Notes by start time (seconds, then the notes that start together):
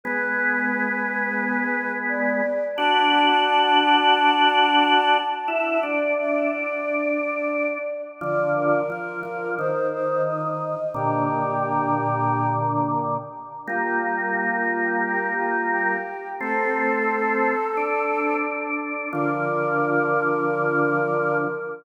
0.04 G#3 B3 B4
2.09 D5
2.76 D4 F#4 A5
5.48 E4 E5
5.83 D4 D5
6.18 E5
6.52 D5
8.21 D3 F3 D5
8.55 A#4
8.90 F3 A#4
9.23 F3
9.58 D#3 C5
9.92 C5
10.25 D#5
10.94 A#2 D3 G4
13.67 G3 A#3 F4
14.01 F4
14.37 F4
15.04 G4
15.37 F4
15.71 G4
16.40 A3 C4 A4
17.77 D4
19.12 D3 F3 A#4